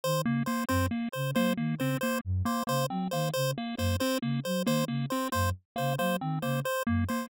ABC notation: X:1
M:6/8
L:1/8
Q:3/8=91
K:none
V:1 name="Flute" clef=bass
^D, ^C, z | ^F,, z ^C, ^F, ^D, C, | z ^F,, z ^C, ^F, ^D, | ^C, z ^F,, z C, ^F, |
^D, ^C, z ^F,, z C, | ^F, ^D, ^C, z ^F,, z |]
V:2 name="Lead 1 (square)"
z ^A, A, | C ^A, z A, A, C | ^A, z A, A, C A, | z ^A, A, C A, z |
^A, A, C A, z A, | ^A, C A, z A, A, |]
V:3 name="Lead 1 (square)"
c z c | c z c c z c | c z c c z c | c z c c z c |
c z c c z c | c z c c z c |]